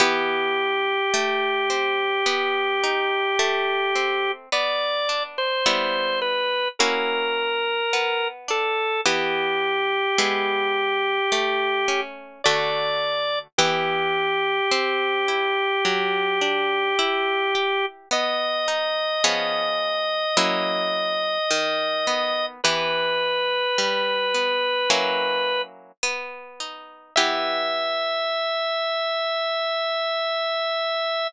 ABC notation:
X:1
M:4/4
L:1/16
Q:1/4=53
K:Em
V:1 name="Drawbar Organ"
G16 | d3 c3 B2 ^A6 =A2 | G12 d4 | G16 |
^d16 | B12 z4 | e16 |]
V:2 name="Acoustic Guitar (steel)"
[E,B,G]4 A,2 C2 B,2 ^D2 A,2 C2 | B,2 D2 [G,B,E]4 [^A,^CEF]4 B,2 D2 | [E,B,G]4 [^G,B,E]4 A,2 ^C2 [D,A,F]4 | [E,B,G]4 C2 E2 F,2 D2 E2 G2 |
B,2 ^D2 [^E,B,^C^G]4 [F,^A,C=E]4 ^D,2 B,2 | [E,B,G]4 G,2 B,2 [F,^A,^CE]4 B,2 ^D2 | [E,B,G]16 |]